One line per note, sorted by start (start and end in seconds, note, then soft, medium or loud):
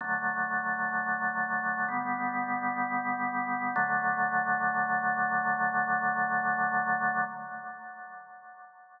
0.01 1.86 D3 medium
0.01 1.86 F#3 medium
0.01 1.86 A3 medium
1.88 3.74 D3 medium
1.88 3.74 G3 medium
1.88 3.74 B3 medium
3.76 7.21 D3 loud
3.76 7.21 F#3 medium
3.76 7.21 A3 loud